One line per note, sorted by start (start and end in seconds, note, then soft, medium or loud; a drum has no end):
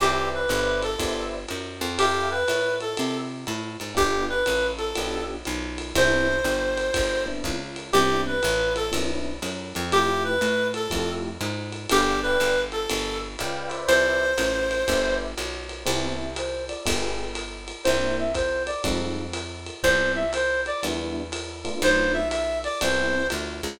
0.00 0.47 C2 medium
0.00 0.29 G4 loud
0.00 0.40 B4 medium
0.00 0.40 C5 medium
0.00 0.40 D5 medium
0.00 0.40 E5 medium
0.00 crash medium
0.00 ride medium
0.34 0.80 B4 medium
0.48 0.96 G1 medium
0.48 0.88 B4 medium
0.48 0.88 C5 medium
0.48 0.88 D5 medium
0.48 0.88 E5 medium
0.48 hi-hat pedal medium
0.48 ride medium
0.82 1.24 A4 medium
0.82 ride medium
0.99 1.46 G1 medium
0.99 1.38 B4 medium
0.99 1.38 C5 medium
0.99 1.38 D5 medium
0.99 1.38 E5 medium
0.99 kick soft
0.99 ride medium
1.48 1.81 F#2 medium
1.48 hi-hat pedal medium
1.48 ride medium
1.81 2.44 F2 medium
1.81 ride medium
1.98 2.30 G4 loud
1.98 2.38 A4 medium
1.98 2.38 E5 medium
1.98 2.38 F5 medium
1.98 2.38 G5 medium
1.98 ride medium
2.30 2.75 B4 medium
2.48 2.95 A2 medium
2.48 hi-hat pedal medium
2.48 ride medium
2.80 3.18 A4 medium
2.80 ride medium
2.97 3.45 C3 medium
2.97 ride medium
3.47 3.77 A2 medium
3.47 hi-hat pedal medium
3.47 ride medium
3.80 3.96 G#2 medium
3.80 ride medium
3.95 4.44 G1 medium
3.95 4.34 B3 medium
3.95 4.34 D4 medium
3.95 4.34 F4 medium
3.95 4.34 G4 medium
3.95 4.25 G4 loud
3.95 kick medium
3.95 ride medium
4.29 4.67 B4 medium
4.46 4.93 A1 medium
4.46 hi-hat pedal medium
4.46 ride medium
4.78 5.24 A4 medium
4.78 ride medium
4.95 5.43 B1 medium
4.95 5.36 B3 medium
4.95 5.36 D4 medium
4.95 5.36 F4 medium
4.95 5.36 G4 medium
4.95 ride medium
5.45 5.93 B1 medium
5.45 hi-hat pedal medium
5.45 ride medium
5.78 ride medium
5.95 6.42 C2 medium
5.95 6.35 B3 medium
5.95 6.35 C4 medium
5.95 6.35 D4 medium
5.95 6.35 E4 medium
5.95 7.24 C5 loud
5.95 kick soft
5.95 ride medium
6.44 6.91 G1 medium
6.44 hi-hat pedal medium
6.44 ride medium
6.77 ride medium
6.94 7.42 G1 medium
6.94 kick medium
6.94 ride medium
7.26 7.56 B3 medium
7.26 7.56 C4 medium
7.26 7.56 D4 medium
7.26 7.56 E4 medium
7.44 7.91 C#2 medium
7.44 kick soft
7.44 hi-hat pedal medium
7.44 ride medium
7.76 ride medium
7.93 8.41 C2 medium
7.93 8.33 B3 medium
7.93 8.33 C4 medium
7.93 8.33 D4 medium
7.93 8.33 E4 medium
7.93 8.21 G4 loud
7.93 ride medium
8.26 8.73 B4 medium
8.43 8.90 A1 medium
8.43 hi-hat pedal medium
8.43 ride medium
8.76 8.93 A4 loud
8.76 ride medium
8.92 9.40 B1 medium
8.92 9.31 B3 medium
8.92 9.31 C4 medium
8.92 9.31 D4 medium
8.92 9.31 E4 medium
8.92 ride medium
9.42 9.73 F#2 medium
9.42 hi-hat pedal medium
9.42 ride medium
9.75 10.39 F2 medium
9.75 ride medium
9.92 10.32 A3 medium
9.92 10.32 E4 medium
9.92 10.32 F4 medium
9.92 10.23 G4 loud
9.92 10.32 G4 medium
9.92 ride medium
10.24 10.68 B4 loud
10.41 10.88 A2 medium
10.41 hi-hat pedal medium
10.41 ride medium
10.74 11.11 A4 loud
10.74 ride medium
10.90 11.38 F2 medium
10.90 11.30 A3 medium
10.90 11.30 E4 medium
10.90 11.30 F4 medium
10.90 11.30 G4 medium
10.90 kick medium
10.90 ride medium
11.41 11.87 G#2 medium
11.41 hi-hat pedal medium
11.41 ride medium
11.72 ride medium
11.89 12.37 G1 medium
11.89 12.20 G4 loud
11.89 12.13 B4 medium
11.89 12.13 D5 medium
11.89 12.13 F5 medium
11.89 12.13 G5 medium
11.89 ride medium
12.22 12.60 B4 loud
12.22 12.54 B4 medium
12.22 12.54 D5 medium
12.22 12.54 F5 medium
12.22 12.54 G5 medium
12.40 12.87 G1 medium
12.40 hi-hat pedal medium
12.40 ride medium
12.72 13.18 A4 loud
12.72 ride medium
12.89 13.36 G1 medium
12.89 ride medium
13.39 13.86 C#2 medium
13.39 13.69 B4 medium
13.39 13.69 D5 medium
13.39 13.71 F5 medium
13.39 13.71 G5 medium
13.39 hi-hat pedal medium
13.39 ride medium
13.69 14.26 B4 medium
13.69 14.26 C5 medium
13.69 14.26 D5 medium
13.69 14.26 E5 medium
13.69 ride medium
13.88 14.35 C2 medium
13.88 15.15 C5 loud
13.88 ride medium
14.38 14.84 A1 medium
14.38 hi-hat pedal medium
14.38 ride medium
14.71 ride medium
14.88 15.35 G1 medium
14.88 15.29 B4 medium
14.88 15.29 C5 medium
14.88 15.29 D5 medium
14.88 15.29 E5 medium
14.88 kick soft
14.88 ride medium
15.38 15.84 B1 medium
15.38 hi-hat pedal medium
15.38 ride medium
15.69 ride medium
15.85 16.72 C2 medium
15.85 16.25 B3 medium
15.85 16.25 C4 medium
15.85 16.25 E4 loud
15.85 16.25 G4 medium
15.85 16.16 C5 loud
15.85 ride medium
16.19 16.33 E5 medium
16.36 16.64 C5 loud
16.36 hi-hat pedal medium
16.36 ride medium
16.68 16.83 D5 loud
16.68 ride medium
16.86 17.73 G1 medium
16.86 17.25 B3 loud
16.86 17.25 F4 medium
16.86 17.25 G4 medium
16.86 17.25 G#4 medium
16.86 kick medium
16.86 ride loud
17.35 hi-hat pedal medium
17.35 ride medium
17.68 ride medium
17.84 18.72 C2 medium
17.84 18.25 A#3 medium
17.84 18.25 C4 medium
17.84 18.25 D4 medium
17.84 18.25 E4 loud
17.84 18.16 C5 loud
17.84 ride medium
18.19 18.33 E5 medium
18.35 18.63 C5 loud
18.35 kick medium
18.35 hi-hat pedal medium
18.35 ride medium
18.66 18.82 D5 medium
18.66 ride medium
18.84 19.70 F2 medium
18.84 19.24 G3 loud
18.84 19.24 G#3 loud
18.84 19.24 D#4 loud
18.84 19.24 F4 medium
18.84 kick medium
18.84 ride medium
19.33 hi-hat pedal medium
19.33 ride medium
19.66 ride medium
19.83 20.69 C2 medium
19.83 20.23 G3 medium
19.83 20.23 B3 loud
19.83 20.23 C4 medium
19.83 20.23 E4 medium
19.83 20.11 C5 loud
19.83 kick soft
19.83 ride medium
20.15 20.31 E5 medium
20.33 20.61 C5 medium
20.33 hi-hat pedal medium
20.33 ride medium
20.66 20.81 D5 medium
20.66 ride medium
20.83 21.69 E2 medium
20.83 21.22 G3 medium
20.83 21.22 B3 loud
20.83 21.22 D4 medium
20.83 21.22 E4 medium
20.83 ride medium
21.32 hi-hat pedal medium
21.32 ride medium
21.64 22.21 A3 medium
21.64 22.21 B3 medium
21.64 22.21 D4 medium
21.64 22.21 F4 loud
21.64 ride medium
21.82 22.68 B1 medium
21.82 22.13 C5 loud
21.82 ride medium
22.13 22.29 E5 medium
22.30 22.59 E5 medium
22.30 hi-hat pedal medium
22.30 ride medium
22.64 22.80 D5 medium
22.64 ride medium
22.81 23.30 C2 medium
22.81 23.22 G3 loud
22.81 23.22 B3 loud
22.81 23.22 C4 loud
22.81 23.22 E4 loud
22.81 23.27 C5 medium
22.81 ride medium
23.30 23.61 D2 medium
23.30 hi-hat pedal medium
23.30 ride medium
23.63 23.79 C#2 medium
23.63 ride medium